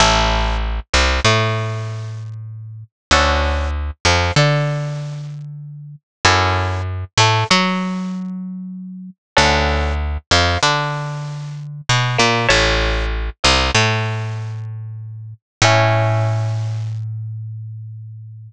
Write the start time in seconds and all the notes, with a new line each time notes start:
0.00 A1 C#4 E4 A4
0.93 C2 C3
1.24 A2 A3
3.11 D2 C#4 D4 F#4 A4
4.05 F2 F3
4.36 D3 D4
6.25 F#2 C#4 E4 F#4 A4
7.17 A2 A3
7.50 F#3 F#4
9.37 D2 C#4 D4 F#4 A4
10.31 F2 F3
10.63 D3 D4
11.89 B2 B3
12.18 A#2 A#3
12.49 A1 C#5 E5 A5
13.44 C2 C3
13.74 A2 A3
15.62 A2 C#4 E4 A4